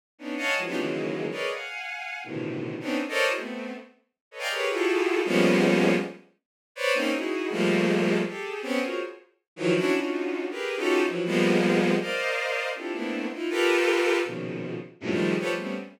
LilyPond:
\new Staff { \time 2/4 \tempo 4 = 160 r8 <b des' d' ees'>8 <des'' ees'' f'' ges'' aes'' a''>8 <e f ges aes>16 <b des' d' ees' f' g'>16 | <des ees e ges aes bes>4. <aes' bes' b' des'' d'' ees''>8 | <f'' ges'' aes''>2 | <a, b, c d ees e>4. <b c' des' d' ees'>8 |
r16 <a' bes' c'' des'' d'' ees''>8 <e' ges' aes' bes' c''>16 <a b c'>4 | r4. <a' b' des'' ees''>16 <d'' ees'' f'' g'' aes'' bes''>16 | <g' aes' bes' b' des''>8 <e' f' ges' g' aes' a'>4. | <f g aes bes b des'>2 |
r2 | <b' c'' des'' d''>8 <bes c' des' ees'>8 <ees' e' ges' aes'>4 | <f g aes a bes>2 | <g' aes' a'>4 <b c' des'>8 <f' ges' aes' bes' c'' des''>8 |
r4. <ees e f ges>8 | <des' d' e' ges'>8 <des' d' ees' f' ges'>4. | <g' aes' bes' b'>8. <des' ees' f' ges' g' a'>8. <e f ges>8 | <f g aes bes b>2 |
<bes' c'' d'' ees'' f''>2 | <c' d' e' f' g' a'>8 <a bes b c' d' e'>4 <ees' e' f'>8 | <f' g' a' bes' b'>2 | <bes, b, des ees f>4. r8 |
<ges, g, a, bes, c>16 <ees f g aes a>8. <f' g' a' b' c'' des''>16 <f g aes a>16 <g a b c' des'>8 | }